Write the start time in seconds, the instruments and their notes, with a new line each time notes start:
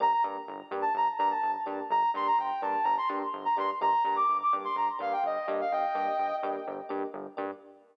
0.00 synth bass 1 G1, electric piano 1 A#3 D4 G4, ocarina A#5
0.12 ocarina A#5
0.24 synth bass 1 G2, electric piano 1 A#3 D4 G4
0.48 synth bass 1 G1
0.71 synth bass 1 G2, electric piano 1 A#3 D4 G4
0.82 ocarina A5
0.95 synth bass 1 G1, ocarina A#5
1.18 synth bass 1 G2, electric piano 1 A#3 D4 G4, ocarina A#5
1.31 ocarina A5
1.43 synth bass 1 G1
1.66 synth bass 1 G2, electric piano 1 A#3 D4 G4
1.90 synth bass 1 G1, ocarina A#5
2.14 synth bass 1 G2, electric piano 1 A#3 D4 G4, ocarina C6
2.27 ocarina A#5
2.38 synth bass 1 G1, ocarina G5
2.62 synth bass 1 G2, electric piano 1 A#3 D4 G4, ocarina A5
2.83 synth bass 1 G1, ocarina A#5
2.98 ocarina C6
3.09 synth bass 1 G2, electric piano 1 A#3 D4 G4
3.34 synth bass 1 G1
3.45 ocarina A#5
3.56 synth bass 1 G2, electric piano 1 A#3 D4 G4, ocarina C6
3.81 synth bass 1 G1, electric piano 1 A#3 D4 G4, ocarina A#5
4.04 synth bass 1 G2, electric piano 1 A#3 D4 G4, ocarina A#5
4.16 ocarina D6
4.29 synth bass 1 G1
4.43 ocarina D6
4.53 synth bass 1 G2, electric piano 1 A#3 D4 G4
4.64 ocarina C6
4.76 synth bass 1 G1, ocarina A#5
4.99 synth bass 1 G2, electric piano 1 A#3 D4 G4, ocarina F5
5.13 ocarina G5
5.24 synth bass 1 G1, ocarina D#5
5.48 synth bass 1 G2, electric piano 1 A#3 D4 G4
5.61 ocarina F5
5.72 synth bass 1 G1, ocarina D#5 G5
5.95 synth bass 1 G2, electric piano 1 A#3 D4 G4
6.19 synth bass 1 G1
6.43 synth bass 1 G2, electric piano 1 A#3 D4 G4
6.67 synth bass 1 G1
6.89 synth bass 1 G2, electric piano 1 A#3 D4 G4
7.14 synth bass 1 G1
7.37 synth bass 1 G2, electric piano 1 A#3 D4 G4